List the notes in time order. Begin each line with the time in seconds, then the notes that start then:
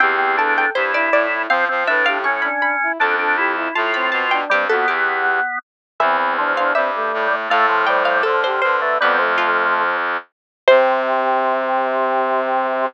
0.00 E2 C4 G4 G5
0.19 C4
0.37 D4 A4 A5
0.57 A4 G5
0.75 G2 E4 G4 C5
0.94 E4 D5
1.12 A2 D5
1.32 E4
1.49 F3 C4 C5 F5
1.68 F3 C4 C5
1.87 A2 D4 B4 E5
2.06 G4 F5
2.24 C#4 C#6
2.42 D4 B5
2.62 B5
2.83 E4
2.99 F2 D4 A4 A5
3.19 D4 A4
3.37 E4 G4
3.56 E4
3.75 A2 A3 F4 A5
3.94 C4 B5
4.12 B2 A5
4.31 D4 G5
4.50 G2 G3 C4 G4
4.69 F2 B3 F#4 A4
4.87 E2 G4
6.00 E2 E3 C4 E5
6.19 E3
6.37 F3 D4
6.57 D4 F5
6.75 G2 G3 C4 E5
6.95 A3
7.14 A2
7.31 A3
7.49 A2 A3 A4 F5
7.69 F3
7.87 G3 C5 G5
8.05 G3 F5
8.23 D3 F3 A4
8.44 G4 C5
8.62 D3 F3 B4 C5
8.80 A3 B4
9.00 F2 G3 B3 B4
9.18 F3 A3
9.38 F4
10.68 C3 C4 C5